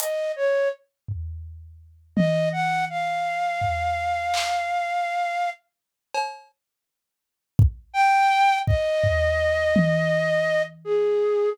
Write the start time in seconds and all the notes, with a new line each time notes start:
0.00 D#5, closed hi-hat
0.36 C#5
1.08 floor tom
2.16 D#5, high tom
2.52 F#5
2.90 F5
3.61 floor tom
4.34 clap
6.14 cowbell
7.59 kick
7.94 G5
8.67 D#5, kick
9.04 floor tom
9.76 high tom
10.85 G#4